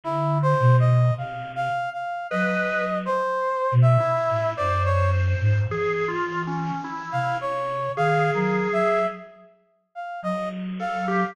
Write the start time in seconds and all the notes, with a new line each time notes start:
0.04 D3 E4
0.42 C5
0.60 B2
0.80 D#5
1.18 C3 F5
1.55 F5
1.93 F5
2.30 F#3 B4 D#5
3.05 C5
3.72 B2
3.82 E5
4.00 E4
4.29 A2
4.57 F#2 C5 D5
4.85 C#5
5.40 G#2
5.70 E3 G#4
6.08 F4
6.47 C#4
6.84 E4
7.12 C3 F5
7.41 C#5
7.96 D#3 G#4 F5
8.34 F#3 A#4
8.72 F#3 E5
9.95 F5
10.22 F#3 D#5
10.79 A4 F5
11.08 G4